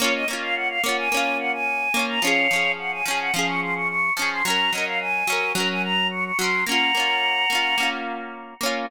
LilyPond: <<
  \new Staff \with { instrumentName = "Choir Aahs" } { \time 4/4 \key bes \minor \tempo 4 = 108 des''16 ees''16 r16 f''16 ges''16 f''16 ges''16 aes''8. ges''16 aes''4 bes''16 | <des'' f''>4 ges''16 aes''16 aes''16 ges''16 f''16 des'''16 c'''16 des'''16 des'''8 des'''16 c'''16 | bes''8 ees''16 f''16 aes''4 bes''16 aes''16 bes''8 des'''16 des'''16 c'''8 | <ges'' bes''>2~ <ges'' bes''>8 r4. | }
  \new Staff \with { instrumentName = "Orchestral Harp" } { \time 4/4 \key bes \minor <bes des' f'>8 <bes des' f'>4 <bes des' f'>8 <bes des' f'>4. <bes des' f'>8 | <f des' aes'>8 <f des' aes'>4 <f des' aes'>8 <f des' aes'>4. <f des' aes'>8 | <ges des' bes'>8 <ges des' bes'>4 <ges des' bes'>8 <ges des' bes'>4. <ges des' bes'>8 | <bes des' f'>8 <bes des' f'>4 <bes des' f'>8 <bes des' f'>4. <bes des' f'>8 | }
>>